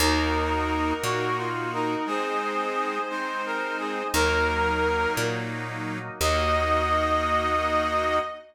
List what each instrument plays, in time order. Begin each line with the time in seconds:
0.00 electric bass (finger) D#2, drawbar organ A#3 D#4 F#4, accordion A#3 D#4 F#4, brass section D#4, violin A#4
1.02 electric bass (finger) A#2, accordion A#3 D#4 F#4, brass section F#4
1.37 brass section F4
1.72 brass section D#4, violin A#4
2.06 accordion G#3 C4 D#4, drawbar organ G#3 C4 D#4, brass section G#4, violin C5
3.10 accordion G#3 C4 D#4, brass section C5
3.46 brass section A#4
3.79 brass section G#4
4.13 electric bass (finger) D#2, accordion F#3 A#3 D#4, drawbar organ F#3 A#3 D#4, brass section A#4, violin A#4
5.17 electric bass (finger) A#2
6.20 electric bass (finger) D#2, accordion A#3 D#4 F#4, drawbar organ A#3 D#4 F#4, violin D#5, brass section D#5